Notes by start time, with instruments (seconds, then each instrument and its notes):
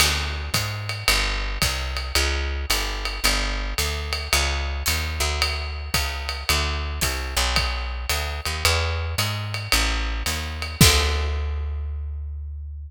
0.00 electric bass (finger) D2, crash, ride
0.54 electric bass (finger) G#2, kick, hi-hat pedal, ride
0.89 ride
1.08 electric bass (finger) G1, ride
1.62 electric bass (finger) C2, kick, hi-hat pedal, ride
1.97 ride
2.15 electric bass (finger) C#2, ride
2.70 electric bass (finger) G1, hi-hat pedal, ride
3.05 ride
3.24 electric bass (finger) G1, ride
3.78 electric bass (finger) D2, hi-hat pedal, ride
4.13 ride
4.33 electric bass (finger) C#2, ride
4.86 electric bass (finger) D#2, hi-hat pedal, ride
5.20 electric bass (finger) D2, ride
5.42 ride
5.94 electric bass (finger) C#2, kick, hi-hat pedal, ride
6.29 ride
6.49 electric bass (finger) D2, ride
7.01 electric bass (finger) C2, kick, hi-hat pedal, ride
7.37 electric bass (finger) B1, ride
7.56 kick, ride
8.09 electric bass (finger) D2, hi-hat pedal, ride
8.45 electric bass (finger) D#2, ride
8.65 electric bass (finger) E2, ride
9.18 electric bass (finger) G#2, hi-hat pedal, ride
9.54 ride
9.72 electric bass (finger) A1, ride
10.26 electric bass (finger) D#2, hi-hat pedal, ride
10.62 ride
10.81 electric bass (finger) D2, kick, crash